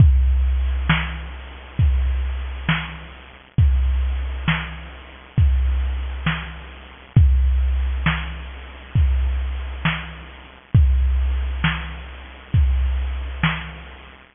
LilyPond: \new DrumStaff \drummode { \time 12/8 \tempo 4. = 67 <hh bd>4 hh8 sn4 hh8 <hh bd>4 hh8 sn4 hh8 | <hh bd>4 hh8 sn4 hh8 <hh bd>4 hh8 sn4 hh8 | <hh bd>4 hh8 sn4 hh8 <hh bd>4 hh8 sn4 hh8 | <hh bd>4 hh8 sn4 hh8 <hh bd>4 hh8 sn4 hh8 | }